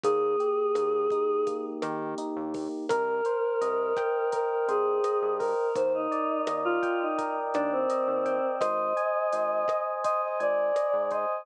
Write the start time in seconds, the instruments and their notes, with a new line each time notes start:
0.04 synth bass 1 D#2, electric piano 1 A#3, choir aahs G#4, kick, closed hi-hat
0.40 electric piano 1 G4, closed hi-hat
0.75 synth bass 1 D#2, electric piano 1 A#3, cross-stick, closed hi-hat
1.10 electric piano 1 D#4, kick, closed hi-hat
1.47 electric piano 1 A#3, kick, closed hi-hat
1.82 synth bass 1 D#3, electric piano 1 G4, cross-stick, closed hi-hat
2.18 electric piano 1 D#4, closed hi-hat
2.36 synth bass 1 D#2
2.54 electric piano 1 A#3, kick, open hi-hat
2.89 synth bass 1 C2, choir aahs A#4, electric piano 1 A#4, kick, cross-stick, closed hi-hat
3.25 electric piano 1 C5, closed hi-hat
3.61 synth bass 1 C2, electric piano 1 D#5, closed hi-hat
3.97 electric piano 1 G5, kick, cross-stick, closed hi-hat
4.32 electric piano 1 A#4, choir aahs A#4, kick, closed hi-hat
4.50 choir aahs A#4
4.68 synth bass 1 C2, choir aahs G#4, electric piano 1 C5, closed hi-hat
5.04 electric piano 1 D#5, cross-stick, closed hi-hat
5.22 synth bass 1 G2
5.39 choir aahs A#4, electric piano 1 A#4, kick, open hi-hat
5.75 synth bass 1 D#2, choir aahs C5, kick, closed hi-hat
5.94 choir aahs D#4
6.12 electric piano 1 D5, closed hi-hat
6.47 synth bass 1 D#2, electric piano 1 D#5, cross-stick, closed hi-hat
6.65 choir aahs F4
6.83 electric piano 1 G5, kick, closed hi-hat
7.01 choir aahs D#4
7.18 electric piano 1 A#4, kick, closed hi-hat
7.54 synth bass 1 D#2, choir aahs D4, electric piano 1 D5, cross-stick, closed hi-hat
7.72 choir aahs C4
7.90 electric piano 1 D#5, closed hi-hat
8.08 synth bass 1 D#2
8.26 electric piano 1 G5, kick, closed hi-hat
8.60 synth bass 1 G#1, electric piano 1 C5, choir aahs D#5, kick, cross-stick, closed hi-hat
8.97 electric piano 1 G#5, closed hi-hat
9.33 synth bass 1 G#1, electric piano 1 C5, closed hi-hat
9.68 electric piano 1 D#5, kick, cross-stick, closed hi-hat
10.04 electric piano 1 C5, choir aahs D#5, kick, closed hi-hat
10.22 choir aahs D#5
10.40 synth bass 1 G#1, choir aahs D5, electric piano 1 G#5, closed hi-hat
10.76 electric piano 1 D#5, cross-stick, closed hi-hat
10.93 synth bass 1 G#2
11.11 electric piano 1 C5, choir aahs D#5, kick, closed hi-hat